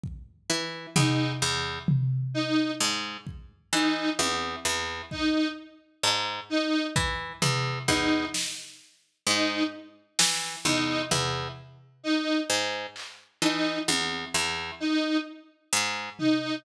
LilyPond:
<<
  \new Staff \with { instrumentName = "Orchestral Harp" } { \clef bass \time 9/8 \tempo 4. = 43 r8 e8 e,8 e,8 r4 aes,8 r8 e8 | e,8 e,8 r4 aes,8 r8 e8 e,8 e,8 | r4 aes,8 r8 e8 e,8 e,8 r4 | aes,8 r8 e8 e,8 e,8 r4 aes,8 r8 | }
  \new Staff \with { instrumentName = "Lead 1 (square)" } { \time 9/8 r4 ees'8 r4 ees'8 r4 ees'8 | r4 ees'8 r4 ees'8 r4 ees'8 | r4 ees'8 r4 ees'8 r4 ees'8 | r4 ees'8 r4 ees'8 r4 ees'8 | }
  \new DrumStaff \with { instrumentName = "Drums" } \drummode { \time 9/8 bd4 tomfh8 r8 tomfh4 cb8 bd4 | tommh4 bd8 r8 cb4 bd8 tomfh8 bd8 | sn4. r8 sn8 tomfh8 tomfh4. | r8 hc8 cb8 tommh4. r8 hh8 tomfh8 | }
>>